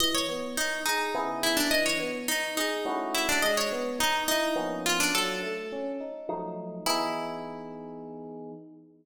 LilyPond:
<<
  \new Staff \with { instrumentName = "Pizzicato Strings" } { \time 3/4 \key e \mixolydian \tempo 4 = 105 dis''16 cis''8. dis'8 dis'4 e'16 d'16 | dis''16 cis''8. dis'8 dis'4 e'16 d'16 | dis''16 cis''8. dis'8 dis'4 eis'16 d'16 | a'4. r4. |
e'2. | }
  \new Staff \with { instrumentName = "Electric Piano 1" } { \time 3/4 \key e \mixolydian e8 b8 dis'8 gis'8 <cis b e' gis'>4 | e8 b8 dis'8 gis'8 <a cis' e' fis'>4 | gis8 b8 dis'8 e'8 <eis ais b cis'>4 | fis8 a8 cis'8 dis'8 <f ges a ees'>4 |
<e b dis' gis'>2. | }
>>